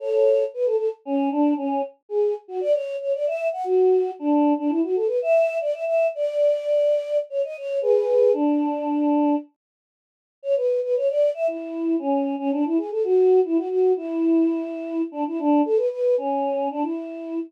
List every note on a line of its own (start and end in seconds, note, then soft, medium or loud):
0.00 0.44 A4 medium
0.00 0.44 C#5 medium
0.54 0.66 B4 medium
0.66 0.76 A4 medium
0.76 0.89 A4 medium
1.05 1.29 C#4 medium
1.31 1.54 D4 medium
1.57 1.82 C#4 medium
2.09 2.34 G#4 medium
2.48 2.60 F#4 medium
2.61 2.73 D5 medium
2.73 2.97 C#5 medium
3.00 3.13 C#5 medium
3.13 3.26 D5 medium
3.27 3.48 E5 medium
3.52 3.65 F#5 medium
3.64 4.11 F#4 medium
4.19 4.53 D4 medium
4.58 4.71 D4 medium
4.69 4.81 E4 medium
4.83 4.95 F#4 medium
4.95 5.08 A4 medium
5.07 5.19 B4 medium
5.22 5.58 E5 medium
5.61 5.73 D5 medium
5.74 5.85 E5 medium
5.85 6.07 E5 medium
6.15 7.17 D5 medium
7.30 7.42 C#5 medium
7.44 7.56 D#5 medium
7.57 7.79 C#5 medium
7.81 8.32 G#4 medium
7.81 8.32 B4 medium
8.33 9.35 D4 medium
10.43 10.55 C#5 medium
10.56 10.80 B4 medium
10.83 10.95 B4 medium
10.96 11.08 C#5 medium
11.09 11.30 D5 medium
11.34 11.47 E5 medium
11.47 11.96 E4 medium
11.99 12.35 C#4 medium
12.39 12.51 C#4 medium
12.52 12.64 D4 medium
12.65 12.77 E4 medium
12.77 12.90 G#4 medium
12.91 13.03 A4 medium
13.04 13.40 F#4 medium
13.45 13.57 E4 medium
13.57 13.68 F#4 medium
13.69 13.92 F#4 medium
13.97 15.02 E4 medium
15.12 15.24 D4 medium
15.27 15.39 E4 medium
15.39 15.61 D4 medium
15.65 15.78 A4 medium
15.76 15.89 B4 medium
15.90 16.15 B4 medium
16.18 16.68 C#4 medium
16.71 16.83 D4 medium
16.82 17.39 E4 medium